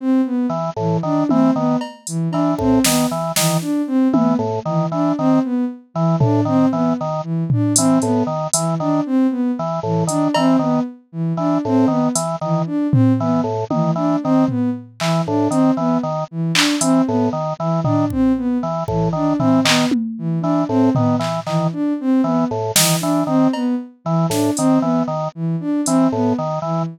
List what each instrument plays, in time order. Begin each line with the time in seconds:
0.00 ocarina C4
0.26 ocarina B3
0.49 drawbar organ E3
0.76 drawbar organ A2, ocarina E3
1.03 drawbar organ D#3, ocarina D4
1.29 drawbar organ E3, ocarina C4, high tom
1.56 drawbar organ D#3, ocarina B3
1.81 cowbell
2.07 ocarina E3, closed hi-hat
2.31 drawbar organ E3, ocarina D4, cowbell
2.58 drawbar organ A2, ocarina C4, kick
2.84 drawbar organ D#3, ocarina B3, snare
3.11 drawbar organ E3
3.36 drawbar organ D#3, ocarina E3, snare
3.61 ocarina D4
3.87 ocarina C4
4.13 drawbar organ E3, ocarina B3, high tom
4.39 drawbar organ A2
4.65 drawbar organ D#3, ocarina E3
4.92 drawbar organ E3, ocarina D4
5.18 drawbar organ D#3, ocarina C4
5.44 ocarina B3
5.94 ocarina E3, drawbar organ E3
6.20 drawbar organ A2, ocarina D4, floor tom
6.45 drawbar organ D#3, ocarina C4
6.72 drawbar organ E3, ocarina B3
7.01 drawbar organ D#3
7.23 ocarina E3
7.50 ocarina D4, floor tom
7.76 drawbar organ E3, ocarina C4, closed hi-hat
8.01 drawbar organ A2, ocarina B3, closed hi-hat
8.27 drawbar organ D#3
8.53 drawbar organ E3, ocarina E3, closed hi-hat
8.80 drawbar organ D#3, ocarina D4
9.06 ocarina C4
9.31 ocarina B3
9.59 drawbar organ E3
9.83 drawbar organ A2, ocarina E3
10.07 drawbar organ D#3, ocarina D4, closed hi-hat
10.34 drawbar organ E3, ocarina C4, cowbell
10.59 drawbar organ D#3, ocarina B3
11.12 ocarina E3
11.37 drawbar organ E3, ocarina D4
11.65 drawbar organ A2, ocarina C4
11.88 drawbar organ D#3, ocarina B3
12.15 drawbar organ E3, closed hi-hat
12.41 drawbar organ D#3, ocarina E3
12.66 ocarina D4
12.92 ocarina C4, floor tom
13.20 drawbar organ E3, ocarina B3
13.44 drawbar organ A2
13.70 drawbar organ D#3, ocarina E3, high tom
13.96 drawbar organ E3, ocarina D4
14.23 drawbar organ D#3, ocarina C4
14.48 ocarina B3, floor tom
15.00 ocarina E3, drawbar organ E3, clap
15.26 drawbar organ A2, ocarina D4
15.50 drawbar organ D#3, ocarina C4, closed hi-hat
15.77 drawbar organ E3, ocarina B3
16.03 drawbar organ D#3
16.31 ocarina E3
16.55 ocarina D4, clap
16.81 drawbar organ E3, ocarina C4, closed hi-hat
17.06 drawbar organ A2, ocarina B3
17.33 drawbar organ D#3
17.59 ocarina E3, drawbar organ E3
17.84 drawbar organ D#3, ocarina D4, floor tom
18.10 ocarina C4, kick
18.37 ocarina B3
18.63 drawbar organ E3
18.88 drawbar organ A2, ocarina E3, kick
19.13 drawbar organ D#3, ocarina D4
19.39 drawbar organ E3, ocarina C4, floor tom
19.65 drawbar organ D#3, ocarina B3, clap
19.91 high tom
20.18 ocarina E3
20.41 drawbar organ E3, ocarina D4
20.69 drawbar organ A2, ocarina C4
20.95 drawbar organ D#3, ocarina B3, floor tom
21.19 drawbar organ E3, clap
21.47 drawbar organ D#3, ocarina E3, clap
21.72 ocarina D4
22.00 ocarina C4
22.24 drawbar organ E3, ocarina B3
22.51 drawbar organ A2
22.76 drawbar organ D#3, ocarina E3, snare
23.00 drawbar organ E3, ocarina D4
23.27 drawbar organ D#3, ocarina C4
23.53 ocarina B3, cowbell
24.05 ocarina E3, drawbar organ E3
24.30 drawbar organ A2, ocarina D4, snare
24.57 drawbar organ D#3, ocarina C4, closed hi-hat
24.81 drawbar organ E3, ocarina B3
25.08 drawbar organ D#3
25.35 ocarina E3
25.60 ocarina D4
25.86 drawbar organ E3, ocarina C4, closed hi-hat
26.12 drawbar organ A2, ocarina B3
26.38 drawbar organ D#3
26.62 drawbar organ E3, ocarina E3